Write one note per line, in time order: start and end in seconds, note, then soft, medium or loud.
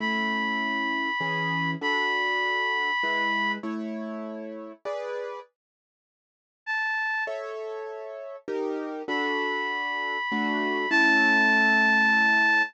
0.00 1.09 A3 loud
0.00 1.09 C#4 medium
0.00 1.09 E4 loud
0.00 1.71 B5 medium
1.21 1.75 E3 loud
1.21 1.75 C#4 medium
1.21 1.75 G#4 loud
1.81 2.91 D4 loud
1.81 2.91 F#4 medium
1.81 2.91 A4 medium
1.81 3.52 B5 medium
3.03 3.58 G#3 medium
3.03 3.58 E4 medium
3.03 3.58 B4 medium
3.63 4.72 A3 medium
3.63 4.72 E4 loud
3.63 4.72 C#5 medium
4.85 5.40 G#4 medium
4.85 5.40 B4 loud
4.85 5.40 D5 loud
6.66 7.24 A5 medium
7.27 8.36 A4 loud
7.27 8.36 C#5 loud
7.27 8.36 E5 loud
8.48 9.02 D#4 loud
8.48 9.02 G4 loud
8.48 9.02 A#4 loud
9.08 10.17 D4 medium
9.08 10.17 F#4 loud
9.08 10.17 A4 loud
9.08 10.90 B5 medium
10.32 10.86 A3 loud
10.32 10.86 D4 loud
10.32 10.86 F#4 loud
10.90 12.63 A3 loud
10.90 12.63 C#4 loud
10.90 12.63 E4 loud
10.90 12.62 A5 loud